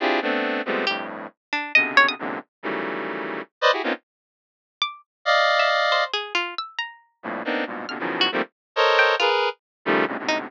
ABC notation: X:1
M:3/4
L:1/16
Q:1/4=137
K:none
V:1 name="Lead 1 (square)"
[CDEFG_A]2 [=A,B,CD]4 [F,G,_A,=A,B,C]2 [F,,G,,A,,]4 | z4 [B,,C,_D,=D,]4 [E,,_G,,_A,,_B,,C,D,]2 z2 | [_D,_E,=E,_G,=G,A,]8 z [Bc=d_e] [=E_G=G_A] [_B,=B,C_D_EF] | z12 |
[d_ef]8 z4 | z6 [F,,G,,A,,_B,,]2 [_B,=B,CD_E]2 [G,,_A,,_B,,=B,,]2 | [_B,,=B,,C,D,] [B,,_D,_E,=E,F,_G,]3 [_E,F,=G,A,_B,C] z3 [A_Bc_d_e]4 | [_A_B=B]3 z3 [_D,_E,F,G,=A,]2 [G,,_A,,=A,,_B,,C,D,] [_A,,=A,,=B,,C,=D,]3 |]
V:2 name="Pizzicato Strings"
z8 G2 z2 | z2 D2 _e2 _d _e' z4 | z12 | z8 d'2 z2 |
z3 e z2 c2 _A2 F2 | e'2 _b6 z4 | f'2 z _G z6 =g2 | F z9 _E z |]